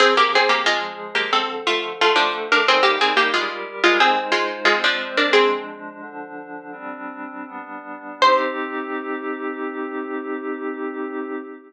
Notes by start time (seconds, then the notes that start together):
0.00 F3 C4 G#4
0.17 A#3 G4
0.35 C4 G#4
0.49 A#3 G4
0.66 F3 G#3 F4 G#4
1.15 A#3 G4
1.32 D3 F3 C4 A4
1.67 A3 F4
2.00 D3 A3 F4 A4
2.16 F3 D4
2.52 D4 A#4
2.67 G3 C4 D#4 G#4 A#4
2.83 A#3 G4
3.01 C4 G#4
3.17 A#3 G4
3.33 G3 G#3 F4 G4 A#4
3.84 G#3 F4
3.99 G#3 C4 D#4 G#4 C5
4.32 G#3 F4
4.65 G#3 C4 F4 C5
4.84 F3 D4
5.17 D4 A#4
5.33 F3 G#3 C4 D4 G#4
6.00 D3 F3 D4
6.72 G3 C4 D4
7.46 G3 B3 D4
8.22 C4 D#4 G4 C5